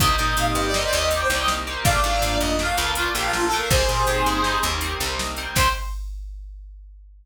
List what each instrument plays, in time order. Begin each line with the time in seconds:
0.00 electric bass (finger) C2, electric piano 2 A#3 C4 D#4 G4, brass section D#5, kick, closed hi-hat
0.18 electric bass (finger) A#2, electric piano 2 A#3 C4 D#4 G4, brass section D#5, closed hi-hat
0.28 brass section D#5
0.37 electric bass (finger) A#2, brass section F5, closed hi-hat
0.48 brass section D#5
0.55 electric bass (finger) G2, brass section D#5, closed hi-hat
0.66 brass section D5
0.74 electric piano 2 A#3 C4 D#4 G4, brass section D#5, snare
0.84 brass section D5
0.93 electric bass (finger) D#2, electric piano 2 A#3 C4 D#4 G4, brass section D#5, closed hi-hat
1.10 electric piano 2 A#3 C4 D#4 G4, brass section D5, closed hi-hat
1.21 brass section C5
1.30 electric bass (finger) C2, electric piano 2 A#3 C4 D#4 G4, brass section D5, closed hi-hat
1.40 brass section D#5
1.48 snare
1.66 electric piano 2 A#3 C4 D#4 G4, closed hi-hat
1.84 electric bass (finger) A#1, electric piano 2 A3 A#3 D4 F4, brass section D5 F5, kick, closed hi-hat
2.04 electric bass (finger) G#2, electric piano 2 A3 A#3 D4 F4, closed hi-hat
2.22 electric bass (finger) G#2, closed hi-hat
2.39 electric bass (finger) F2, brass section D#5, closed hi-hat
2.59 electric piano 2 A3 A#3 D4 F4, brass section F5, snare
2.77 electric bass (finger) C#2, electric piano 2 A3 A#3 D4 F4, closed hi-hat
2.95 electric piano 2 A3 A#3 D4 F4, brass section F4, closed hi-hat
3.14 electric bass (finger) A#1, electric piano 2 A3 A#3 D4 F4, brass section G4, closed hi-hat
3.24 brass section F4
3.33 brass section F4, snare
3.45 brass section A4
3.52 electric piano 2 A3 A#3 D4 F4, closed hi-hat
3.57 brass section A#4
3.69 electric bass (finger) C2, electric piano 2 G3 A#3 C4 D#4, brass section G#4 C5, kick, closed hi-hat
3.88 electric bass (finger) A#2, electric piano 2 G3 A#3 C4 D#4, closed hi-hat
4.07 electric bass (finger) A#2, closed hi-hat
4.26 electric bass (finger) G2, closed hi-hat
4.44 electric piano 2 G3 A#3 C4 D#4, snare
4.62 electric bass (finger) D#2, electric piano 2 G3 A#3 C4 D#4, closed hi-hat
4.81 electric piano 2 G3 A#3 C4 D#4, closed hi-hat
5.00 electric bass (finger) C2, electric piano 2 G3 A#3 C4 D#4, closed hi-hat
5.19 snare
5.36 electric piano 2 G3 A#3 C4 D#4, closed hi-hat
5.55 electric bass (finger) C2, electric piano 2 A#3 C4 D#4 G4, brass section C5, kick, crash